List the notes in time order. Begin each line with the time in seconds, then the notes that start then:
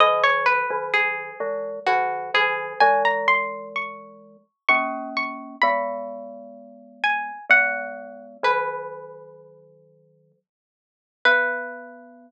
0.00 D#3 F#3 D#5
0.24 C#5
0.46 B4
0.70 D#3 F#3
0.94 G#4
1.40 E3 G#3
1.87 D#3 F#3 F#4
2.34 D#3 F#3 G#4
2.80 E3 G#3 G#5
3.05 A#5
3.28 C6
3.76 C#6
4.69 A#3 C#4 C#6
5.17 C#6
5.62 G#3 B3 B5
7.04 G#5
7.49 G#3 B3 F#5
8.43 D#3 F#3 B4
11.25 B3 B4